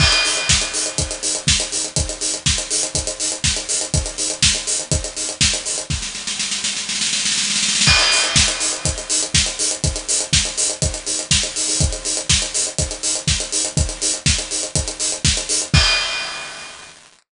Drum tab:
CC |x-------------------------------|--------------------------------|--------------------------------|--------------------------------|
HH |--x-o-x---x-o-x-x-x-o-x---x-o-x-|x-x-o-x---x-o-x-x-x-o-x---x-o-x-|x-x-o-x---x-o-x-x-x-o-x---x-o-x-|--------------------------------|
SD |--------o---------------o-------|--------o---------------o-------|--------o---------------o-------|o-o-o-o-o-o-o-o-oooooooooooooooo|
BD |o-------o-------o-------o-------|o-------o-------o-------o-------|o-------o-------o-------o-------|o-------------------------------|

CC |x-------------------------------|--------------------------------|--------------------------------|--------------------------------|
HH |--x-o-x---x-o-x-x-x-o-x---x-o-x-|x-x-o-x---x-o-x-x-x-o-x---x-o-o-|x-x-o-x---x-o-x-x-x-o-x---x-o-x-|x-x-o-x---x-o-x-x-x-o-x---x-o-x-|
SD |--------o---------------o-------|--------o---------------o-------|--------o---------------o-------|--------o---------------o-------|
BD |o-------o-------o-------o-------|o-------o-------o-------o-------|o-------o-------o-------o-------|o-------o-------o-------o-------|

CC |x-------------------------------|
HH |--------------------------------|
SD |--------------------------------|
BD |o-------------------------------|